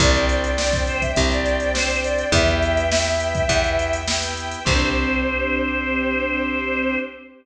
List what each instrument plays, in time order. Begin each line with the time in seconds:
0.00 electric bass (finger) C2, drawbar organ C4 D4 G4, string ensemble 1 C5 D5 G5, choir aahs D5, kick, closed hi-hat
0.14 choir aahs D5, closed hi-hat
0.29 closed hi-hat
0.44 closed hi-hat
0.57 drawbar organ C4 D4 G4, choir aahs D5, snare
0.73 kick, closed hi-hat
0.87 choir aahs C5, closed hi-hat
1.01 choir aahs E5, kick, closed hi-hat
1.16 electric bass (finger) C2, drawbar organ C4 D4 G4, kick, closed hi-hat
1.31 choir aahs D5, closed hi-hat
1.46 closed hi-hat
1.60 choir aahs D5, closed hi-hat
1.74 drawbar organ C4 D4 G4, choir aahs C5, snare
1.89 closed hi-hat
2.04 choir aahs D5, closed hi-hat
2.18 closed hi-hat
2.32 electric bass (finger) E2, drawbar organ B3 E4 G4, string ensemble 1 B4 E5 G5, choir aahs E5, kick, closed hi-hat
2.48 closed hi-hat
2.62 closed hi-hat
2.77 closed hi-hat
2.92 drawbar organ B3 E4 G4, snare
3.06 closed hi-hat
3.20 closed hi-hat
3.35 kick, closed hi-hat
3.49 electric bass (finger) E2, drawbar organ B3 E4 G4, kick, closed hi-hat
3.64 closed hi-hat
3.79 closed hi-hat
3.93 closed hi-hat
4.07 drawbar organ B3 E4 G4, snare
4.23 closed hi-hat
4.37 closed hi-hat
4.51 closed hi-hat
4.65 electric bass (finger) C2, drawbar organ C4 D4 G4, string ensemble 1 C4 D4 G4, choir aahs C5, kick, crash